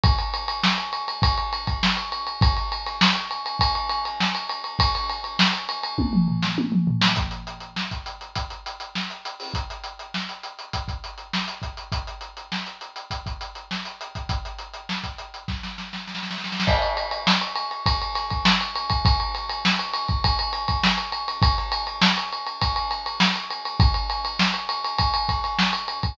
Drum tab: CC |--------------------------------|--------------------------------|--------------------------------|--------------------------------|
RD |x-x-x-x---x-x-x-x-x-x-x---x-x-x-|x-x-x-x---x-x-x-x-x-x-x---x-x-x-|x-x-x-x---x-x-x-----------------|--------------------------------|
HH |--------------------------------|--------------------------------|--------------------------------|x-x-x-x---x-x-x-x-x-x-x---x-x-o-|
SD |--------o---------------o-------|--------o---------------o-------|--------o-------------o-------o-|--------o---------------o-------|
T1 |--------------------------------|--------------------------------|----------------o-------o-------|--------------------------------|
T2 |--------------------------------|--------------------------------|------------------o-------o-----|--------------------------------|
FT |--------------------------------|--------------------------------|--------------------o-------o---|--------------------------------|
BD |o---------------o-----o---------|o---------------o---------------|o---------------o---------------|o---------o-----o---------------|

CC |--------------------------------|--------------------------------|--------------------------------|x-------------------------------|
RD |--------------------------------|--------------------------------|--------------------------------|--x-x-x---x-x-x-x-x-x-x---x-x-x-|
HH |x-x-x-x---x-x-x-x-x-x-x---x-x-x-|x-x-x-x---x-x-x-x-x-x-x---x-x-x-|x-x-x-x---x-x-x-----------------|--------------------------------|
SD |--------o---------------o-------|--------o---------------o-------|--------o-------o-o-o-o-oooooooo|--------o---------------o-------|
T1 |--------------------------------|--------------------------------|--------------------------------|--------------------------------|
T2 |--------------------------------|--------------------------------|--------------------------------|--------------------------------|
FT |--------------------------------|--------------------------------|--------------------------------|--------------------------------|
BD |o---------------o-o---------o---|o---------------o-o-----------o-|o---------o-----o---------------|o---------------o-----o-------o-|

CC |--------------------------------|--------------------------------|--------------------------------|
RD |x-x-x-x---x-x-x-x-x-x-x---x-x-x-|x-x-x-x---x-x-x-x-x-x-x---x-x-x-|x-x-x-x---x-x-x-x-x-x-x---x-x-x-|
HH |--------------------------------|--------------------------------|--------------------------------|
SD |--------o---------------o-------|--------o---------------o-------|--------o---------------o-------|
T1 |--------------------------------|--------------------------------|--------------------------------|
T2 |--------------------------------|--------------------------------|--------------------------------|
FT |--------------------------------|--------------------------------|--------------------------------|
BD |o-------------o-o-----o---------|o---------------o---------------|o---------------o---o---------o-|